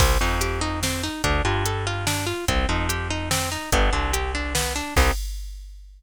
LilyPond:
<<
  \new Staff \with { instrumentName = "Orchestral Harp" } { \time 3/4 \key c \dorian \tempo 4 = 145 c'8 ees'8 g'8 ees'8 c'8 ees'8 | d'8 f'8 a'8 f'8 d'8 f'8 | c'8 ees'8 g'8 ees'8 c'8 ees'8 | b8 d'8 g'8 d'8 b8 d'8 |
<c' ees' g'>4 r2 | }
  \new Staff \with { instrumentName = "Electric Bass (finger)" } { \clef bass \time 3/4 \key c \dorian c,8 f,2~ f,8 | d,8 g,2~ g,8 | c,8 f,2~ f,8 | g,,8 c,2~ c,8 |
c,4 r2 | }
  \new DrumStaff \with { instrumentName = "Drums" } \drummode { \time 3/4 <cymc bd>4 hh4 sn4 | <hh bd>4 hh4 sn4 | <hh bd>4 hh4 sn4 | <hh bd>4 hh4 sn4 |
<cymc bd>4 r4 r4 | }
>>